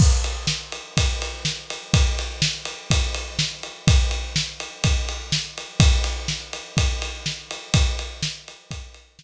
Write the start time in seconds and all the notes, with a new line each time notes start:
0.00 kick, crash
0.24 ride
0.47 snare
0.72 ride
0.97 kick, ride
1.22 ride
1.45 snare
1.70 ride
1.94 kick, ride
2.19 ride
2.42 snare
2.65 ride
2.90 kick, ride
3.14 ride
3.39 snare
3.63 ride
3.88 kick, ride
4.11 ride
4.36 snare
4.60 ride
4.84 kick, ride
5.09 ride
5.32 snare
5.58 ride
5.80 kick, ride
6.04 ride
6.28 snare
6.53 ride
6.77 kick, ride
7.02 ride
7.26 snare
7.51 ride
7.74 kick, ride
7.99 ride
8.22 snare
8.48 ride
8.71 kick, ride
8.94 ride
9.19 snare